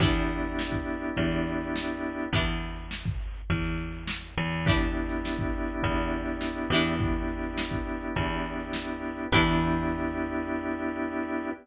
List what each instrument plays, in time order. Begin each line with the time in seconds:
0.00 electric bass (finger) E2, drawbar organ B3 D4 E4 G4, acoustic guitar (steel) D4 E4 G4 B4, kick, crash
0.15 closed hi-hat
0.29 closed hi-hat
0.44 closed hi-hat
0.59 snare
0.72 kick, closed hi-hat
0.88 closed hi-hat
1.02 closed hi-hat
1.16 electric bass (finger) E2, kick, closed hi-hat
1.31 closed hi-hat
1.47 closed hi-hat
1.61 closed hi-hat
1.76 snare
1.89 closed hi-hat
2.03 closed hi-hat
2.19 closed hi-hat
2.33 electric bass (finger) E2, acoustic guitar (steel) D4 E4 G4 B4, kick, closed hi-hat
2.47 closed hi-hat
2.62 closed hi-hat
2.76 closed hi-hat
2.91 snare
3.05 kick, closed hi-hat
3.20 closed hi-hat
3.35 closed hi-hat
3.50 electric bass (finger) E2, kick, closed hi-hat
3.64 snare, closed hi-hat
3.78 closed hi-hat
3.93 closed hi-hat
4.08 snare
4.23 closed hi-hat
4.36 electric bass (finger) E2, closed hi-hat
4.51 closed hi-hat
4.66 drawbar organ B3 D4 E4 G4, acoustic guitar (steel) D4 E4 G4 B4, kick, closed hi-hat
4.81 closed hi-hat
4.95 closed hi-hat
5.09 snare, closed hi-hat
5.25 snare
5.39 kick, closed hi-hat
5.53 closed hi-hat
5.68 closed hi-hat
5.83 electric bass (finger) E2, kick, closed hi-hat
5.98 closed hi-hat
6.11 closed hi-hat
6.26 closed hi-hat
6.41 snare
6.56 closed hi-hat
6.70 electric bass (finger) E2, acoustic guitar (steel) E4 G4 B4, closed hi-hat
6.74 acoustic guitar (steel) D4
6.85 open hi-hat
6.99 drawbar organ B3 D4 E4 G4, kick, closed hi-hat
7.13 closed hi-hat
7.28 closed hi-hat
7.43 closed hi-hat
7.58 snare
7.71 kick, closed hi-hat
7.87 closed hi-hat
8.01 closed hi-hat
8.15 electric bass (finger) E2, kick, closed hi-hat
8.30 closed hi-hat
8.45 closed hi-hat
8.60 closed hi-hat
8.73 snare
8.88 closed hi-hat
9.04 closed hi-hat
9.17 closed hi-hat
9.32 electric bass (finger) E2, drawbar organ B3 D4 E4 G4, acoustic guitar (steel) D4 E4 G4 B4, kick, crash